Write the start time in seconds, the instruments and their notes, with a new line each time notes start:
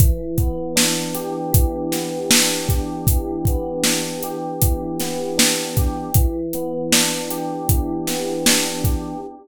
0.00 electric piano 1 E3, kick, closed hi-hat
0.38 electric piano 1 B3, kick, closed hi-hat
0.76 electric piano 1 D4, snare
1.15 electric piano 1 G4, closed hi-hat
1.53 electric piano 1 E3, kick, closed hi-hat
1.92 electric piano 1 B3, snare, closed hi-hat
2.30 electric piano 1 D4, snare
2.69 electric piano 1 G4, kick, closed hi-hat
3.07 electric piano 1 E3, kick, closed hi-hat
3.45 electric piano 1 B3, kick, closed hi-hat
3.83 electric piano 1 D4, snare
4.23 electric piano 1 G4, closed hi-hat
4.62 electric piano 1 E3, kick, closed hi-hat
5.00 electric piano 1 B3, snare, closed hi-hat
5.38 electric piano 1 D4, snare
5.77 electric piano 1 G4, kick, closed hi-hat
6.14 electric piano 1 E3, kick, closed hi-hat
6.53 electric piano 1 B3, closed hi-hat
6.92 electric piano 1 D4, snare
7.30 electric piano 1 G4, closed hi-hat
7.69 electric piano 1 E3, kick, closed hi-hat
8.07 electric piano 1 B3, snare, closed hi-hat
8.46 electric piano 1 D4, snare
8.84 electric piano 1 G4, kick, closed hi-hat